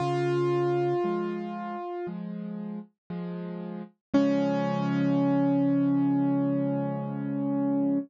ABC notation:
X:1
M:4/4
L:1/8
Q:1/4=58
K:Db
V:1 name="Acoustic Grand Piano"
F5 z3 | D8 |]
V:2 name="Acoustic Grand Piano" clef=bass
D,2 [F,A,]2 [F,A,]2 [F,A,]2 | [D,F,A,]8 |]